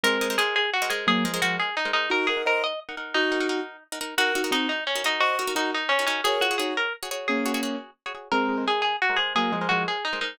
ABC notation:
X:1
M:6/8
L:1/16
Q:3/8=116
K:Ebdor
V:1 name="Pizzicato Strings"
B4 A2 A2 G2 A2 | A4 G2 A2 E2 E2 | B2 A2 B2 e2 z4 | E10 z2 |
G4 E2 E2 D2 E2 | G4 E2 E2 D2 D2 | A2 G2 A2 B2 z4 | A6 z6 |
B4 A2 A2 G2 A2 | A4 G2 A2 E2 E2 |]
V:2 name="Acoustic Grand Piano"
[A,C]4 z8 | [G,B,]2 [F,A,]2 [F,A,]2 z6 | [EG]2 [GB]2 [ce]2 z6 | [EG]6 z6 |
[GB]2 [EG]2 [CE]2 z6 | [ce]2 [GB]2 [EG]2 z6 | [Bd]2 [FA]2 [EG]2 z6 | [B,D]6 z6 |
[A,C]4 z8 | [G,B,]2 [F,A,]2 [F,A,]2 z6 |]
V:3 name="Pizzicato Strings"
[A,Bce]2 [A,Bce] [A,Bce] [A,Bce]5 [A,Bce] [A,Bce]2- | [A,Bce]2 [A,Bce] [A,Bce] [A,Bce]5 [A,Bce] [A,Bce]2 | [EBg]2 [EBg] [EBg] [EBg]5 [EBg] [EBg]2- | [EBg]2 [EBg] [EBg] [EBg]5 [EBg] [EBg]2 |
[EGB]2 [EGB] [EGB] [EGB]5 [EGB] [EGB]2- | [EGB]2 [EGB] [EGB] [EGB]5 [EGB] [EGB]2 | [GAd]2 [GAd] [GAd] [GAd]5 [GAd] [GAd]2- | [GAd]2 [GAd] [GAd] [GAd]5 [GAd] [GAd]2 |
[A,Bce]2 [A,Bce] [A,Bce] [A,Bce]5 [A,Bce] [A,Bce]2- | [A,Bce]2 [A,Bce] [A,Bce] [A,Bce]5 [A,Bce] [A,Bce]2 |]